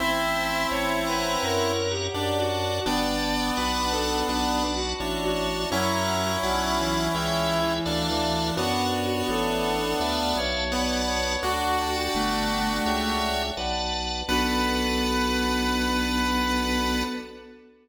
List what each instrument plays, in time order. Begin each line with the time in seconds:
0.00 drawbar organ A1 C5, lead 1 (square) C4 E4, acoustic grand piano C5 E5 A5, pad 5 (bowed) C5 E5 A5, violin E5
0.36 drawbar organ A5
0.71 drawbar organ A1 C#5, pad 5 (bowed) C#5 E5 A5, violin C#5, acoustic grand piano C#5 E5 A5
1.07 violin B4, drawbar organ C#5 F#5 A#5
1.42 drawbar organ F#2, violin A#4, acoustic grand piano C#5 F#5 A#5, pad 5 (bowed) C#5 F#5 A#5
1.90 violin G4
2.14 drawbar organ F#2 D5, lead 1 (square) D4, acoustic grand piano D5 F#5 A5, pad 5 (bowed) D5 F#5 A5
2.38 violin F#4
2.50 drawbar organ F#5
2.85 drawbar organ G1 D5 G5 A5, lead 1 (square) B3 D4, violin D5, acoustic grand piano D5 G5 A5, pad 5 (bowed) D5 G5 A5
3.57 drawbar organ B1 D5 F#5 A5 B5, violin B4, pad 5 (bowed) D5 F#5 A5 B5, acoustic grand piano D5 F#5
3.61 acoustic grand piano A5 B5
3.92 violin A4, acoustic grand piano D5 F#5 A5
3.97 acoustic grand piano B5
4.27 drawbar organ B1 D5 F#5 A5 B5, violin D4, acoustic grand piano D5 F#5, pad 5 (bowed) D5 F#5 A5 B5
4.32 acoustic grand piano A5 B5
4.76 violin F#4
5.00 drawbar organ A1 C#5, lead 1 (square) D4, pad 5 (bowed) C#5 E5 A5, acoustic grand piano C#5 E5 A5
5.23 violin F#4
5.36 drawbar organ A5
5.71 drawbar organ F#2 C#5 F#5 A#5, violin F#3, lead 1 (square) C#4 E4, acoustic grand piano C#5 F#5 A#5, pad 5 (bowed) C#5 F#5 A#5
6.43 drawbar organ B1 D5 F#5 A5 B5, violin F#3, acoustic grand piano D5 F#5 A5, pad 5 (bowed) D5 F#5 A5 B5
6.47 acoustic grand piano B5
6.78 violin E3
7.14 drawbar organ C#2 C#5 E5 G5, violin E3, acoustic grand piano C#5 E5 G5, pad 5 (bowed) C#5 E5 G5
7.51 acoustic grand piano C#5 E5 G5
7.62 violin E3
7.85 drawbar organ D2 D5 E5 F5 A5, lead 1 (square) D4, pad 5 (bowed) D5 E5 F5 A5, acoustic grand piano D5 E5 F5
7.90 acoustic grand piano A5
8.09 violin E3
8.56 drawbar organ F#2 C#5 F#5 A5, lead 1 (square) B3 D4, violin F#4, pad 5 (bowed) C#5 F#5 A5, acoustic grand piano C#5 F#5
8.60 acoustic grand piano A5
8.93 drawbar organ C#5
9.28 drawbar organ A1, violin A4, pad 5 (bowed) C#5 E5 A5, acoustic grand piano C#5 E5 A5
9.64 drawbar organ A5
10.00 drawbar organ D2 D5 E5 F5 A5, acoustic grand piano D5 E5 F5, pad 5 (bowed) D5 E5 F5 A5
10.04 acoustic grand piano A5
10.36 drawbar organ B1, violin C#5
10.71 lead 1 (square) B3, acoustic grand piano D5 F#5 A5, drawbar organ D5 F#5 A5 B5, pad 5 (bowed) D5 F#5 A5 B5
10.75 acoustic grand piano B5
11.08 violin C#5
11.43 drawbar organ D2 D5, lead 1 (square) D4 F#4, violin F#4, acoustic grand piano D5 F#5 A5, pad 5 (bowed) D5 F#5 A5
11.78 drawbar organ D5 G5 A5, acoustic grand piano D5 G5
11.82 acoustic grand piano A5
12.14 drawbar organ G1, violin A3, pad 5 (bowed) D5 G5 A5
12.86 drawbar organ C#2 C#5 E5 G5, acoustic grand piano C#5 E5 G5, pad 5 (bowed) C#5 E5 G5
13.57 drawbar organ B1 B4 D5 F#5 A5, pad 5 (bowed) B4 D5 F#5 A5, acoustic grand piano B4 D5 F#5
13.62 acoustic grand piano A5
14.28 drawbar organ B1 B4 D5 F#5 A5, violin B3, acoustic grand piano B3 D4, pad 5 (bowed) B3 D4 F#4 A4, lead 1 (square) B4
14.32 acoustic grand piano F#4 A4